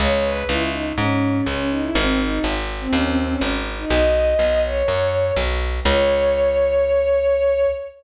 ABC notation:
X:1
M:4/4
L:1/16
Q:1/4=123
K:C#m
V:1 name="Violin"
c c B2 E2 D z C4 C2 D E | ^B, B, D2 z3 B, C B, B, C z3 D | d6 c6 z4 | c16 |]
V:2 name="Electric Bass (finger)" clef=bass
C,,4 C,,4 G,,4 C,,4 | G,,,4 G,,,4 D,,4 G,,,4 | B,,,4 B,,,4 F,,4 B,,,4 | C,,16 |]